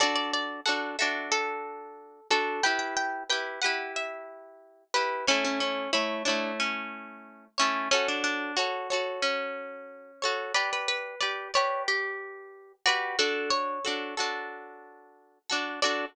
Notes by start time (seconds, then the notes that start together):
0.00 D4 F#4 A4 D5
0.16 D5
0.34 D5
0.66 D4 F#4 A4 F#5
0.99 D4 F#4 A4 E5
1.32 A4
2.30 D4 F#4 A4
2.63 E4 G4 B4 G5
2.79 G5
2.97 G5
3.30 E4 G4 B4 G5
3.62 G4 B4 F#5
3.66 E4
3.96 E5
4.94 E4 G4 B4
5.27 A3 C#4 E4 C#5
5.45 C#4
5.60 C#4
5.93 A3 E4 C#5
6.25 A3 D4 E4 C#5
6.60 C#4
7.58 A3 C#4 E4 C#5
7.91 C#4 F#4 A4 C#5
8.08 D4
8.24 D4
8.57 F#4 A4 C#5
8.90 F#4 A4 C#5
9.22 C#4
10.22 F#4 A4 C#5
10.54 G4 B4 D5
10.73 B4
10.88 B4
11.20 G4 B4 D5
11.54 G4 B4 C#5 D5
11.88 G4
12.86 F#4 G4 B4 D5
13.19 D4 F#4 A4
13.50 C#5
13.85 D4 F#4 A4
14.17 D4 F#4 A4
15.50 D4 F#4 A4
15.82 D4 F#4 A4 D5